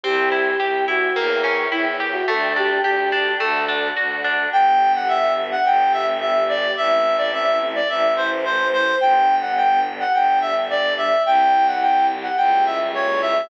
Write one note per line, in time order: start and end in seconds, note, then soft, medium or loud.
0.04 0.54 C2 loud
0.04 0.29 C4 loud
0.04 0.85 G4 medium
0.04 1.15 C5 medium
0.04 1.15 E5 medium
0.04 1.15 G5 medium
0.32 0.57 E4 medium
0.60 1.10 C2 medium
0.60 0.85 G4 medium
0.88 1.13 E4 medium
0.88 1.16 F#4 medium
1.15 1.66 E2 loud
1.15 1.41 A#3 medium
1.15 1.66 A#4 medium
1.15 2.27 A#4 medium
1.15 2.27 C#5 medium
1.15 2.27 E5 medium
1.15 2.27 G5 medium
1.44 1.69 C#4 medium
1.72 2.22 E2 medium
1.72 1.97 E4 medium
1.72 1.85 E4 medium
2.00 2.25 G4 medium
2.12 2.26 F#4 medium
2.28 2.79 D2 loud
2.28 2.53 A3 loud
2.28 3.39 A4 medium
2.28 2.55 A4 medium
2.28 3.39 D5 medium
2.28 3.39 G5 medium
2.56 2.81 D4 medium
2.56 2.81 G4 medium
2.84 3.34 D2 medium
2.84 3.09 G4 medium
2.84 3.32 G4 medium
3.12 3.37 D4 medium
3.39 3.91 D2 loud
3.39 3.65 A3 medium
3.39 3.88 A4 medium
3.39 4.51 A4 medium
3.39 4.51 D5 medium
3.39 4.51 F#5 medium
3.68 3.94 D4 medium
3.96 4.47 D2 medium
3.96 4.22 F#4 medium
4.24 4.50 D4 medium
4.52 5.56 G1 loud
4.52 5.63 B3 medium
4.52 5.63 D4 medium
4.52 5.63 G4 medium
4.52 4.92 G5 medium
4.95 5.08 F#5 medium
5.08 5.34 E5 medium
5.51 5.65 F#5 medium
5.64 6.68 G1 loud
5.64 6.75 G3 medium
5.64 6.75 B3 medium
5.64 6.75 G4 loud
5.64 5.92 G5 medium
5.93 6.06 E5 medium
6.21 6.44 E5 medium
6.49 6.72 D5 medium
6.77 7.80 A1 loud
6.77 7.88 A3 medium
6.77 7.88 C4 medium
6.77 7.88 E4 medium
6.77 7.16 E5 medium
7.17 7.30 D5 medium
7.33 7.59 E5 medium
7.75 7.88 D5 medium
7.89 8.92 A1 loud
7.89 9.00 E3 medium
7.89 9.00 A3 medium
7.89 9.00 E4 medium
7.89 8.14 E5 medium
8.16 8.30 C5 medium
8.45 8.68 C5 medium
8.73 8.95 C5 medium
9.01 10.04 G1 loud
9.01 10.12 G3 medium
9.01 10.12 B3 medium
9.01 10.12 D4 medium
9.01 9.35 G5 medium
9.41 9.54 F#5 medium
9.57 9.80 G5 medium
10.00 10.13 F#5 medium
10.13 11.16 G1 medium
10.13 11.24 G3 medium
10.13 11.24 D4 medium
10.13 11.24 G4 medium
10.13 10.39 G5 medium
10.41 10.54 E5 medium
10.70 10.93 D5 medium
10.97 11.22 E5 medium
11.25 12.28 C2 loud
11.25 11.81 G3 medium
11.25 11.81 C4 medium
11.25 11.81 E4 medium
11.25 11.66 G5 medium
11.67 11.80 F#5 medium
11.81 12.37 G3 medium
11.81 12.37 E4 medium
11.81 12.37 G4 medium
11.81 12.06 G5 medium
12.22 12.36 F#5 medium
12.37 13.41 C#2 loud
12.37 12.93 G3 medium
12.37 12.93 A#3 medium
12.37 12.93 C#4 medium
12.37 12.93 E4 medium
12.37 12.64 G5 medium
12.66 12.79 E5 medium
12.94 13.49 G3 medium
12.94 13.49 A#3 medium
12.94 13.49 E4 medium
12.94 13.49 G4 loud
12.94 13.21 C#5 medium
13.21 13.48 E5 medium